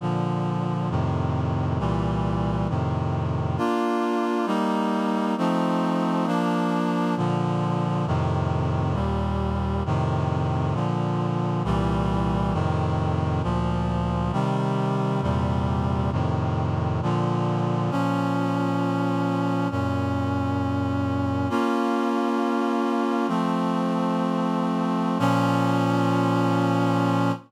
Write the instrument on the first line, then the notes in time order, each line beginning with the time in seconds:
clarinet
0.01 A#2 D3 F3
0.90 F2 A2 C3 D#3
1.79 C2 A#2 E3 G3
2.69 F2 A2 C3 D#3
3.58 A#3 D4 F4
4.46 G3 A#3 D#4
5.38 F3 A3 C4 D#4
6.26 F3 A#3 D4
7.17 A#2 D3 F3
8.06 F2 A2 C3 D#3
8.94 D#2 A#2 G3
9.86 F2 A2 C3 D#3
10.74 A#2 D3 F3
11.64 C2 A#2 E3 G3
12.53 F2 A2 C3 D#3
13.43 D2 A#2 F3
14.32 C3 D#3 G3
15.22 E2 A#2 C3 G3
16.12 F2 A2 C3 D#3
17.02 A#2 D3 F3
17.91 A#2 F3 C#4
19.71 F#2 A#2 C#4
21.50 A#3 C#4 F4
23.28 F3 A3 C4
25.19 A#2 F3 C#4